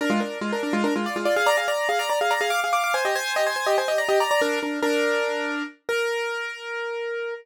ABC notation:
X:1
M:7/8
L:1/16
Q:1/4=143
K:Bbmix
V:1 name="Acoustic Grand Piano"
[DB] [A,F] [DB]2 [A,F] [DB] [DB] [A,F] [DB] [A,F] [Fd] [A,F] [Fd] [Af] | [db] [Af] [db]2 [Af] [db] [db] [Af] [db] [Af] [fd'] [Af] [fd'] [fd'] | [ca] [Ge] [ca]2 [Ge] [ca] [ca] [Ge] [ca] [Ge] [db] [Ge] [db] [db] | [DB]2 [DB]2 [DB]8 z2 |
B14 |]